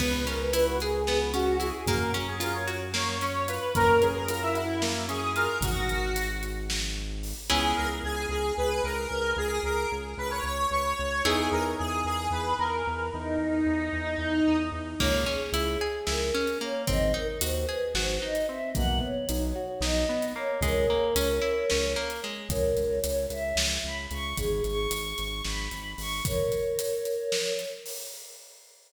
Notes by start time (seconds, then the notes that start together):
0.00 C#2 B3 B4, kick, crash
0.27 C#4 A#4, closed hi-hat
0.40 B4
0.53 E4 B4, closed hi-hat
0.67 F#4
0.80 G#4, closed hi-hat
1.07 B3, snare
1.34 C#4 F#4, closed hi-hat
1.60 E4 G#4, closed hi-hat
1.86 F#2 A#3 A#4, kick, closed hi-hat
2.14 C#4, closed hi-hat
2.28 G#4
2.40 F4 A#4, closed hi-hat
2.55 C#5
2.68 F#4, closed hi-hat
2.94 A#3 C#5, snare
3.21 C#4 C#5, closed hi-hat
3.48 F4 B4, closed hi-hat
3.75 F#2 A#3 A#4, kick, closed hi-hat
4.02 C#4 G#4, closed hi-hat
4.15 A#4
4.28 F4 A#4, closed hi-hat
4.42 E4
4.55 E4 F#4, closed hi-hat
4.82 A#3, snare
5.09 C#4 G#4, closed hi-hat
5.36 F4 A#4, closed hi-hat
5.61 G#1 F#4, kick, closed hi-hat
5.89 closed hi-hat
6.16 closed hi-hat
6.43 closed hi-hat
6.70 snare
7.23 open hi-hat
7.50 C#2 B3 C#4 E4 G#4
7.76 C#2 A#4
8.03 C#2 G#4
8.29 C#2 G#4
8.57 C#2 B4
8.84 C#2 A#4
9.11 C#2
9.36 C#2 G#4
9.63 C#2 A#4
9.92 C#2
10.17 C#2 B4
10.31 C#5
10.43 C#2 C#5
10.71 C#2 C#5
10.99 C#2
11.25 E2 B3 D#4 E4 G#4
11.52 E2 A#4
11.78 E2 G#4
12.05 E2 G#4
12.31 E2 B4
12.59 E2 A#4
12.87 E2
13.13 E2 D#4
13.38 E2
13.66 E2
13.93 E2
14.18 E2
14.47 E2
14.72 E2
15.00 C#2 A#3 C#5, kick, crash
15.26 C#4 G#4
15.52 C#2 E4, closed hi-hat
15.81 G#4
16.07 C#2 E4 A#4, snare
16.34 C#4
16.47 closed hi-hat
16.61 A#3 C#5
16.87 G#1 C4 D#5, kick, closed hi-hat
17.14 D#4 A#4
17.41 D#2 F#4 C5, closed hi-hat
17.68 G#4 B4
17.94 G#1 F#4 C5, snare
18.22 D#4 D#5
18.35 closed hi-hat
18.48 C4 E5
18.75 B1 A#3 F#5, kick, closed hi-hat
19.01 B3 C#5
19.29 B1 D#4, closed hi-hat
19.56 F#4
19.81 B1 D#4 D#5, snare
20.09 B3
20.22 closed hi-hat
20.36 A#3 C#5
20.61 C#2 G#3 A#4 C#5, kick, closed hi-hat
20.90 A#3
21.15 C#2 C#4, closed hi-hat
21.42 E4
21.70 C#2 C#4, snare
21.96 A#3
22.10 closed hi-hat
22.24 G#3
22.49 C#2 A#4 C#5, kick, closed hi-hat
22.77 C#2, closed hi-hat
23.04 C#2 C#5, closed hi-hat
23.30 C#2 E5, closed hi-hat
23.56 C#2, snare
23.84 C#2 B5
24.11 C#2 C#6, closed hi-hat
24.37 G#1 G#4, kick, closed hi-hat
24.64 G#1 C#6, closed hi-hat
24.91 G#1, closed hi-hat
25.18 G#1, closed hi-hat
25.44 G#1 B5, snare
25.71 G#1, closed hi-hat
25.98 G#1 C#6, open hi-hat
26.25 A#4 C#5, kick, closed hi-hat
26.52 closed hi-hat
26.79 closed hi-hat
27.05 closed hi-hat
27.32 snare
27.59 closed hi-hat
27.86 open hi-hat